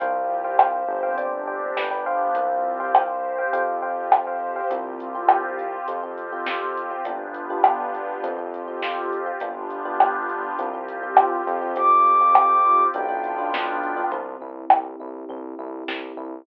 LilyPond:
<<
  \new Staff \with { instrumentName = "Ocarina" } { \time 4/4 \key c \major \tempo 4 = 102 r1 | r1 | r1 | r1 |
r1 | d'''2 g''2 | r1 | }
  \new Staff \with { instrumentName = "Electric Piano 1" } { \time 4/4 \key c \major <c'' f'' g''>8. <c'' f'' g''>16 <c'' f'' g''>8. <c'' f'' g''>16 <c'' d'' g''>8 <c'' d'' g''>8 <b' d'' g''>16 <b' d'' g''>16 <c'' f'' g''>8~ | <c'' f'' g''>8. <c'' f'' g''>16 <c'' f'' g''>8. <c'' f'' g''>16 <c'' f'' g''>8 <c'' f'' g''>8. <c'' f'' g''>8 <c'' f'' g''>16 | <c' f' g'>8. <c' f' g'>4~ <c' f' g'>16 <c' f' g'>16 <c' f' g'>8 <c' f' g'>16 <c' f' g'>8. <c' f' g'>16 | <b d' f' g'>8. <b d' f' g'>4~ <b d' f' g'>16 <c' f' g'>16 <c' f' g'>8 <c' f' g'>16 <c' f' g'>8. <c' f' g'>16 |
<b d' f' g'>8. <b d' f' g'>4~ <b d' f' g'>16 <c' f' g'>16 <c' f' g'>8 <c' f' g'>16 <c' f' g'>8. <c' f' g'>16 | <c' f' g'>8. <c' f' g'>4~ <c' f' g'>16 <b d' f'>16 <b d' f'>8 <b d' f'>16 <b d' f'>8. <b d' f'>16 | c'8 e'8 g'8 e'8 c'8 e'8 g'8 e'8 | }
  \new Staff \with { instrumentName = "Synth Bass 1" } { \clef bass \time 4/4 \key c \major c,4. g,,4. g,,4 | c,2 f,2 | c,2 f,2 | g,,2 f,2 |
g,,2 c,4. f,8~ | f,2 b,,2 | c,8 c,8 c,8 c,8 c,8 c,8 c,8 c,8 | }
  \new Staff \with { instrumentName = "Pad 2 (warm)" } { \time 4/4 \key c \major <c' f' g'>4 <c' g' c''>4 <c' d' g'>4 <b d' g'>4 | <c' f' g'>4 <c' g' c''>4 <c' f' g'>4 <c' g' c''>4 | <c' f' g'>2 <c' f' g'>2 | <b d' f' g'>2 <c' f' g'>2 |
<b d' f' g'>2 <c' f' g'>2 | <c' f' g'>2 <b d' f'>2 | r1 | }
  \new DrumStaff \with { instrumentName = "Drums" } \drummode { \time 4/4 <hh bd>4 ss4 hh4 sn4 | <hh bd>4 ss4 hh4 ss4 | <hh bd>8 hh8 ss8 hh8 hh8 hh8 sn8 hh8 | <hh bd>8 hh8 ss8 hh8 hh8 hh8 sn8 hh8 |
<hh bd>8 hh8 ss8 hh8 hh8 hh8 ss8 hh8 | <hh bd>8 hh8 ss8 hh8 hh8 hh8 sn8 hh8 | <bd tomfh>8 tomfh8 ss8 tomfh8 tomfh8 tomfh8 sn8 tomfh8 | }
>>